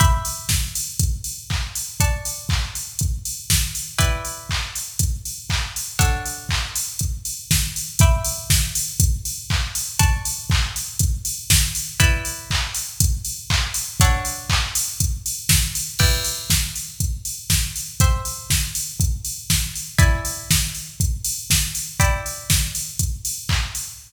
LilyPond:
<<
  \new Staff \with { instrumentName = "Pizzicato Strings" } { \time 4/4 \key e \minor \tempo 4 = 120 <e'' b'' d''' g'''>1 | <d'' a'' cis''' fis'''>1 | <e' b' d'' g''>1 | <d' a' cis'' fis''>1 |
<e'' b'' d''' g'''>1 | <d'' a'' cis''' fis'''>1 | <e' b' d'' g''>1 | <d' a' cis'' fis''>1 |
<e' b' d'' g''>1 | <c'' e'' g''>1 | <e' d'' gis'' b''>1 | <e' d'' g'' b''>1 | }
  \new DrumStaff \with { instrumentName = "Drums" } \drummode { \time 4/4 <hh bd>8 hho8 <bd sn>8 hho8 <hh bd>8 hho8 <hc bd>8 hho8 | <hh bd>8 hho8 <hc bd>8 hho8 <hh bd>8 hho8 <bd sn>8 hho8 | <hh bd>8 hho8 <hc bd>8 hho8 <hh bd>8 hho8 <hc bd>8 hho8 | <hh bd>8 hho8 <hc bd>8 hho8 <hh bd>8 hho8 <bd sn>8 hho8 |
<hh bd>8 hho8 <bd sn>8 hho8 <hh bd>8 hho8 <hc bd>8 hho8 | <hh bd>8 hho8 <hc bd>8 hho8 <hh bd>8 hho8 <bd sn>8 hho8 | <hh bd>8 hho8 <hc bd>8 hho8 <hh bd>8 hho8 <hc bd>8 hho8 | <hh bd>8 hho8 <hc bd>8 hho8 <hh bd>8 hho8 <bd sn>8 hho8 |
<cymc bd>8 hho8 <bd sn>8 hho8 <hh bd>8 hho8 <bd sn>8 hho8 | <hh bd>8 hho8 <bd sn>8 hho8 <hh bd>8 hho8 <bd sn>8 hho8 | <hh bd>8 hho8 <bd sn>8 hho8 <hh bd>8 hho8 <bd sn>8 hho8 | <hh bd>8 hho8 <bd sn>8 hho8 <hh bd>8 hho8 <hc bd>8 hho8 | }
>>